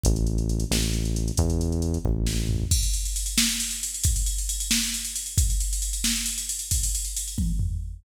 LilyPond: <<
  \new Staff \with { instrumentName = "Synth Bass 1" } { \clef bass \time 6/8 \key e \major \tempo 4. = 90 a,,4. a,,4. | e,4. a,,4. | \key cis \minor r2. | r2. |
r2. | r2. | }
  \new DrumStaff \with { instrumentName = "Drums" } \drummode { \time 6/8 <hh bd>16 hh16 hh16 hh16 hh16 hh16 sn16 hh16 hh16 hh16 hh16 hh16 | <hh bd>16 hh16 hh16 hh16 hh16 hh16 bd8 sn8 tomfh8 | <cymc bd>16 cymr16 cymr16 cymr16 cymr16 cymr16 sn16 cymr16 cymr16 cymr16 cymr16 cymr16 | <bd cymr>16 cymr16 cymr16 cymr16 cymr16 cymr16 sn16 cymr16 cymr16 cymr16 cymr16 cymr16 |
<bd cymr>16 cymr16 cymr16 cymr16 cymr16 cymr16 sn16 cymr16 cymr16 cymr16 cymr16 cymr16 | <bd cymr>16 cymr16 cymr16 cymr16 cymr16 cymr16 <bd tommh>8 tomfh4 | }
>>